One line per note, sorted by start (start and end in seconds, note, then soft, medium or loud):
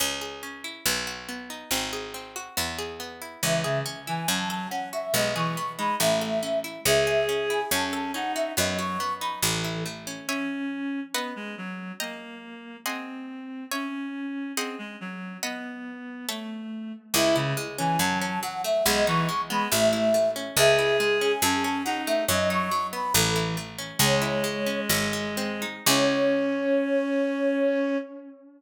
0.00 0.79 C#2 medium
0.00 0.42 C#4 medium
0.21 0.82 G#4 medium
0.43 0.84 C#4 medium
0.64 0.85 E4 medium
0.86 1.64 B1 medium
0.86 1.28 B3 loud
1.07 1.68 F#4 medium
1.29 1.69 B3 medium
1.50 1.70 D#4 medium
1.71 2.50 G#1 medium
1.71 2.14 C4 medium
1.93 2.54 G#4 medium
2.14 2.55 C4 medium
2.36 2.56 F#4 medium
2.57 3.36 E2 medium
2.57 2.99 B3 loud
2.78 3.40 G#4 medium
3.00 3.41 B3 medium
3.22 3.42 E4 medium
3.42 4.22 C#2 medium
3.42 3.63 E3 medium
3.42 3.85 C#4 medium
3.42 3.79 E5 medium
3.64 3.82 C#3 loud
3.64 4.25 G#4 medium
3.86 4.26 C#4 medium
4.07 4.26 E3 medium
4.07 4.28 E4 medium
4.07 4.28 G#5 medium
4.28 5.07 F#2 medium
4.28 4.67 F#3 medium
4.28 4.71 C#4 loud
4.28 4.49 A5 medium
4.49 5.11 A4 medium
4.49 4.68 A5 medium
4.70 5.12 C#4 medium
4.70 4.89 F#5 medium
4.93 5.13 F#4 medium
4.93 5.14 E5 medium
5.14 5.93 B1 medium
5.14 5.31 G#3 loud
5.14 5.57 B3 loud
5.14 5.34 D#5 medium
5.35 5.56 E3 loud
5.35 5.97 G#4 medium
5.35 5.72 C#6 medium
5.57 5.98 B3 medium
5.78 5.96 G#3 medium
5.78 5.99 D#4 medium
5.78 5.95 B5 medium
6.00 6.79 A1 medium
6.00 6.39 A3 medium
6.00 6.42 C#4 loud
6.00 6.59 E5 medium
6.21 6.82 A4 medium
6.43 6.83 C#4 medium
6.64 6.85 E4 medium
6.85 7.64 C#2 loud
6.85 7.28 C#4 loud
6.85 7.60 G#4 loud
6.85 7.25 E5 medium
7.07 7.68 G#4 medium
7.29 7.69 C#4 medium
7.50 7.70 E4 medium
7.50 7.72 G#5 medium
7.71 8.50 F#2 loud
7.71 8.11 C#4 medium
7.71 8.14 C#4 loud
7.71 7.92 A5 medium
7.93 8.54 A4 medium
7.93 8.12 A5 medium
8.14 8.55 C#4 medium
8.14 8.52 D#4 medium
8.14 8.32 F#5 medium
8.35 8.56 F#4 medium
8.35 8.52 E5 medium
8.57 9.37 F#2 medium
8.57 8.97 F#3 loud
8.57 8.99 B3 medium
8.57 8.78 D#5 medium
8.79 9.40 F#4 medium
8.79 9.14 C#6 medium
9.00 9.41 B3 medium
9.20 9.42 D#4 medium
9.20 9.39 B5 medium
9.42 10.21 A1 medium
9.42 9.84 E3 medium
9.42 9.85 A3 medium
9.42 9.83 A4 medium
9.64 10.25 E4 medium
9.86 10.26 A3 medium
10.07 10.27 C#4 medium
10.28 11.00 C#4 medium
10.28 11.06 C#5 medium
10.28 11.06 E5 medium
10.28 11.06 G#5 loud
11.14 11.33 B3 medium
11.14 11.92 B4 loud
11.14 11.92 D#5 loud
11.14 11.92 F#5 medium
11.36 11.55 G#3 medium
11.58 11.92 F#3 medium
12.00 12.77 A#3 medium
12.00 12.77 D#5 loud
12.00 12.77 G5 medium
12.00 12.77 A#5 medium
12.86 13.65 C4 medium
12.86 13.63 G#4 loud
12.86 13.63 D#5 medium
12.86 13.63 F#5 loud
12.86 13.63 C6 medium
13.71 14.52 C#4 medium
13.71 14.49 C#5 medium
13.71 14.49 E5 medium
13.71 14.49 G#5 medium
14.57 14.75 C4 medium
14.57 15.34 G#4 loud
14.57 15.34 C5 loud
14.57 15.34 D#5 loud
14.57 15.34 F#5 loud
14.79 14.96 G#3 medium
15.01 15.37 F#3 medium
15.43 16.26 B3 medium
15.43 16.20 B4 medium
15.43 16.20 D#5 medium
15.43 16.20 F#5 loud
16.29 16.92 A3 medium
16.29 17.06 A4 loud
16.29 17.06 C#5 loud
16.29 17.06 E5 medium
17.14 17.93 C#2 loud
17.14 17.57 G#3 loud
17.14 17.35 E4 loud
17.14 17.36 E5 medium
17.36 17.53 C#3 loud
17.36 17.97 E4 medium
17.57 17.98 G#3 medium
17.78 17.97 E3 loud
17.78 17.99 C#4 medium
17.78 17.99 G#5 medium
17.99 18.78 F#2 medium
17.99 18.42 F#3 medium
17.99 18.39 F#3 loud
17.99 18.19 A5 medium
18.21 18.82 C#4 medium
18.21 18.41 A5 medium
18.43 18.83 F#3 medium
18.43 18.62 F#5 medium
18.64 18.85 A3 medium
18.64 18.85 E5 medium
18.86 19.64 B1 loud
18.86 19.28 G#3 loud
18.86 19.04 G#3 loud
18.86 19.07 D#5 medium
19.06 19.28 E3 loud
19.06 19.68 D#4 medium
19.06 19.41 C#6 medium
19.29 19.69 G#3 medium
19.50 19.68 G#3 loud
19.50 19.70 B3 medium
19.50 19.70 B5 medium
19.71 20.51 A1 medium
19.71 20.10 A3 loud
19.71 20.14 A3 loud
19.71 20.31 E5 loud
19.93 20.54 E4 medium
20.14 20.55 A3 medium
20.36 20.56 C#4 medium
20.57 21.35 C#2 loud
20.57 20.99 G#3 loud
20.57 21.32 G#4 loud
20.57 20.97 E5 medium
20.79 21.40 E4 medium
21.00 21.41 G#3 medium
21.21 21.42 C#4 medium
21.21 21.42 G#5 medium
21.42 22.21 F#2 loud
21.42 21.85 F#3 loud
21.42 21.82 C#4 loud
21.42 21.63 A5 medium
21.64 22.25 C#4 medium
21.64 21.83 A5 medium
21.85 22.26 F#3 medium
21.85 22.24 D#4 loud
21.85 22.02 F#5 medium
22.07 22.28 A3 medium
22.07 22.25 E5 medium
22.28 23.07 F#2 medium
22.28 22.71 F#3 loud
22.28 22.69 F#3 loud
22.28 22.49 D#5 medium
22.50 23.11 D#4 medium
22.50 22.87 C#6 medium
22.71 23.12 F#3 medium
22.93 23.13 B3 medium
22.93 23.13 B5 medium
23.14 23.93 A1 loud
23.14 23.56 E3 loud
23.14 23.57 A3 loud
23.14 23.57 A4 medium
23.36 23.97 E4 medium
23.57 23.98 A3 medium
23.78 23.99 C#4 medium
23.99 24.81 C#2 loud
23.99 24.43 G#3 loud
23.99 25.65 G#3 loud
23.99 24.80 C#5 medium
24.22 24.86 E4 medium
24.44 24.87 G#3 medium
24.66 24.88 C#4 medium
24.89 25.79 G#1 medium
24.89 25.82 F#3 loud
25.13 25.83 G#3 medium
25.37 25.85 C4 loud
25.62 25.86 D#4 medium
25.86 27.95 C#2 loud
25.86 27.96 C#4 loud
25.86 27.96 E4 loud
25.86 27.96 G#4 loud
25.86 27.98 C#5 loud